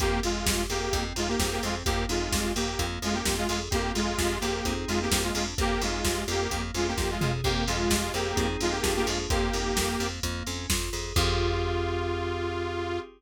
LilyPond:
<<
  \new Staff \with { instrumentName = "Lead 2 (sawtooth)" } { \time 4/4 \key f \minor \tempo 4 = 129 <bes g'>8 <aes f'>4 <bes g'>8. r16 <aes f'>16 <bes g'>8 <bes g'>16 <aes f'>16 r16 | <bes g'>8 <aes f'>4 <bes g'>8. r16 <aes f'>16 <bes g'>8 <aes f'>16 <aes f'>16 r16 | <bes g'>8 <aes f'>4 <bes g'>8. r16 <aes f'>16 <bes g'>8 <aes f'>16 <aes f'>16 r16 | <bes g'>8 <aes f'>4 <bes g'>8. r16 <aes f'>16 <bes g'>8 <aes f'>16 <aes f'>16 r16 |
<bes g'>8 <aes f'>4 <bes g'>8. r16 <aes f'>16 <bes g'>8 <bes g'>16 <aes f'>16 r16 | <bes g'>2 r2 | f'1 | }
  \new Staff \with { instrumentName = "Electric Piano 2" } { \time 4/4 \key f \minor c'8 f'8 g'8 aes'8 c'8 ees'8 aes'8 c'8 | bes8 ees'8 g'8 bes8 bes8 des'8 f'8 aes'8 | c'8 f'8 g'8 aes'8 <c' ees' aes'>4 bes8 d'8 | bes8 ees'8 g'8 bes8 bes8 des'8 f'8 aes'8 |
c'8 f'8 g'8 aes'8 <c' ees' aes'>4 <bes d' f' aes'>4 | bes8 ees'8 g'8 bes8 bes8 des'8 f'8 aes'8 | <c' f' g' aes'>1 | }
  \new Staff \with { instrumentName = "Electric Bass (finger)" } { \clef bass \time 4/4 \key f \minor f,8 f,8 f,8 f,8 f,8 f,8 f,8 f,8 | f,8 f,8 f,8 f,8 f,8 f,8 f,8 f,8 | f,8 f,8 f,8 f,8 f,8 f,8 f,8 f,8 | f,8 f,8 f,8 f,8 f,8 f,8 f,8 f,8 |
f,8 f,8 f,8 f,8 f,8 f,8 f,8 f,8 | f,8 f,8 f,8 f,8 f,8 f,8 f,8 f,8 | f,1 | }
  \new DrumStaff \with { instrumentName = "Drums" } \drummode { \time 4/4 <hh bd>8 hho8 <bd sn>8 hho8 <hh bd>8 hho8 <bd sn>8 hho8 | <hh bd>8 hho8 <bd sn>8 hho8 <hh bd>8 hho8 <bd sn>8 hho8 | <hh bd>8 hho8 <bd sn>8 hho8 <hh bd>8 hho8 <bd sn>8 hho8 | <hh bd>8 hho8 <bd sn>8 hho8 <hh bd>8 hho8 <bd sn>8 toml8 |
<cymc bd>8 hho8 <bd sn>8 hho8 <hh bd>8 hho8 <bd sn>8 hho8 | <hh bd>8 hho8 <bd sn>8 hho8 <hh bd>8 hho8 <bd sn>8 hho8 | <cymc bd>4 r4 r4 r4 | }
>>